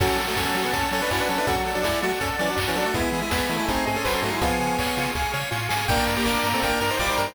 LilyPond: <<
  \new Staff \with { instrumentName = "Lead 1 (square)" } { \time 4/4 \key fis \minor \tempo 4 = 163 <cis' a'>8. <a fis'>16 <cis' a'>8. <b gis'>16 <cis' a'>8 <cis' a'>16 <d' b'>16 <e' cis''>16 <d' b'>16 <cis' a'>16 <d' b'>16 | <cis' a'>16 r8 <fis d'>16 <gis e'>8 <a fis'>16 r16 <cis' a'>16 r16 <e cis'>16 <fis d'>16 r16 <e cis'>16 <fis d'>16 <a fis'>16 | <b gis'>8. <gis e'>16 <b gis'>8. <gis e'>16 <bis gis'>8 <bis gis'>16 <cis' a'>16 b'16 <cis' a'>16 <a fis'>16 <gis e'>16 | <b gis'>2 r2 |
\key g \minor <d' bes'>8. <bes g'>16 <d' bes'>8. <c' a'>16 <d' bes'>8 <d' bes'>16 <ees' c''>16 <f' d''>16 <ees' c''>16 <d' bes'>16 <ees' c''>16 | }
  \new Staff \with { instrumentName = "Brass Section" } { \time 4/4 \key fis \minor fis8 fis4. r4 cis'8 cis'16 e'16 | fis4 r2. | gis4. a4. fis4 | eis4 r2. |
\key g \minor bes4. bes8 bes8 r8 g4 | }
  \new Staff \with { instrumentName = "Lead 1 (square)" } { \time 4/4 \key fis \minor fis'8 a'8 cis''8 fis'8 a'8 cis''8 fis'8 a'8 | fis'8 a'8 d''8 fis'8 a'8 d''8 fis'8 a'8 | e'8 gis'8 b'8 e'8 dis'8 gis'8 bis'8 dis'8 | eis'8 gis'8 cis''8 eis'8 gis'8 cis''8 eis'8 gis'8 |
\key g \minor g''8 bes''8 d'''8 bes''8 g''8 bes''8 d'''8 bes''8 | }
  \new Staff \with { instrumentName = "Synth Bass 1" } { \clef bass \time 4/4 \key fis \minor fis,8 fis8 fis,8 fis8 fis,8 fis8 fis,8 fis8 | fis,8 fis8 fis,8 fis8 fis,8 fis8 fis,8 fis8 | e,8 e8 e,8 e8 gis,,8 gis,8 gis,,8 gis,8 | cis,8 cis8 cis,8 cis8 cis,8 cis8 a,8 gis,8 |
\key g \minor g,,8 g,8 g,,8 g,8 g,,8 g,8 g,,8 g,8 | }
  \new Staff \with { instrumentName = "String Ensemble 1" } { \time 4/4 \key fis \minor <cis'' fis'' a''>1 | <d'' fis'' a''>1 | <e'' gis'' b''>2 <dis'' gis'' bis''>2 | <eis'' gis'' cis'''>1 |
\key g \minor <bes' d'' g''>1 | }
  \new DrumStaff \with { instrumentName = "Drums" } \drummode { \time 4/4 <cymc bd>8 hho8 <bd sn>8 hho8 <hh bd>8 hho8 <hc bd>8 hho8 | <hh bd>8 hho8 <bd sn>8 hho8 <hh bd>8 hho8 <hc bd>8 hho8 | <hh bd>8 hho8 <bd sn>8 hho8 <hh bd>8 hho8 <hc bd>8 hho8 | <hh bd>8 hho8 <hc bd>8 hho8 <bd sn>8 sn8 sn8 sn8 |
<cymc bd>8 hho8 <hc bd>8 hho8 <hh bd>8 hho8 <hc bd>8 hho8 | }
>>